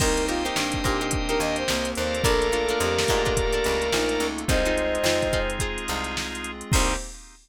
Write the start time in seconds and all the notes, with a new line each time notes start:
0.00 C2 A#3 C4 D#4 G4 A#4 C5 D#5 G5, kick, crash
0.17 closed hi-hat
0.28 D#4 F4 G4 A#4 C5, snare, closed hi-hat
0.45 D#4 G4 A#4 C5, snare, closed hi-hat
0.55 G2 D4, snare
0.72 kick, closed hi-hat
0.84 A#2 D#4 G4 A#4 C5, kick, snare, closed hi-hat
1.01 D#4 G4 A#4 C5, closed hi-hat
1.11 A#3 C4 G4 A#4, kick, closed hi-hat
1.29 D#4 G4 A#4 C5, snare, closed hi-hat
1.40 D#2 D#5, snare, closed hi-hat
1.56 C5, closed hi-hat
1.68 C2 A#3, snare
1.85 closed hi-hat
1.95 D#2 A4 A#4 C5 D5 F5, closed hi-hat
2.14 closed hi-hat
2.24 A#1 A3 A#3 D4 F4 A4 A#4, kick, closed hi-hat
2.41 snare, closed hi-hat
2.52 D4 F4 A4 A#4, snare, closed hi-hat
2.69 D4 F4 A4 A#4, closed hi-hat
2.79 F2 G4, closed hi-hat
2.98 snare
3.08 G#2 D4 F4 A4 A#4, kick, closed hi-hat
3.25 D4 F4 A4 A#4, kick, closed hi-hat
3.37 A3 A#3 F4 A4, kick, closed hi-hat
3.53 D4 F4 A4 A#4, closed hi-hat
3.64 C#2, closed hi-hat
3.82 closed hi-hat
3.92 A#1 D#4, snare
4.09 closed hi-hat
4.20 C#2, closed hi-hat
4.38 closed hi-hat
4.48 C2 G#3 C4 D#4 F4 G#4 C5 D#5, kick, closed hi-hat
4.65 D#4 F4 G#4 C5, closed hi-hat
4.78 closed hi-hat
4.95 closed hi-hat
5.04 F2 D#4 F4 G#4 C5, snare
5.22 kick, closed hi-hat
5.33 D#4 F4 G#4 C5, kick, snare, closed hi-hat
5.50 closed hi-hat
5.59 G#3 C4 D#4 F4 G#4 C5, kick, closed hi-hat
5.78 closed hi-hat
5.88 C2 D#4 F4 G#4 C5, closed hi-hat
6.04 snare, closed hi-hat
6.17 snare
6.32 snare, closed hi-hat
6.44 closed hi-hat
6.61 closed hi-hat
6.72 C2 A#3 C4 D#4 G4 A#4 C5, kick, crash